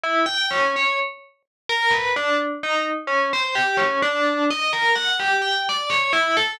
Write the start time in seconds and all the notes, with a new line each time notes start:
0.04 E4
0.26 G5
0.51 C#4
0.76 C#5
1.69 A#4
1.91 B4
2.16 D4
2.63 D#4
3.07 C#4
3.33 C5
3.55 G4
3.77 C#4
4.02 D4
4.51 D#5
4.73 A#4
4.96 F#5
5.20 G4
5.42 G5
5.69 D5
5.90 C#5
6.13 E4
6.37 A4